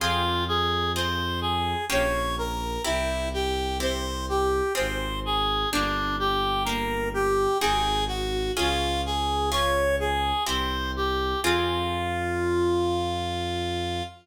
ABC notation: X:1
M:3/4
L:1/8
Q:1/4=63
K:Fm
V:1 name="Clarinet"
F A c A d B | =E G c G c A | =D G B G A _G | F A d A c G |
F6 |]
V:2 name="Orchestral Harp"
[CFA]2 [CFA]2 [B,DG]2 | [C=EG]2 [CEG]2 [CFA]2 | [B,=DG]2 [B,DG]2 [CE_GA]2 | [DFA]2 [DFA]2 [C=EG]2 |
[CFA]6 |]
V:3 name="Violin" clef=bass
F,,4 B,,,2 | C,,4 A,,,2 | G,,,4 A,,,2 | D,,4 C,,2 |
F,,6 |]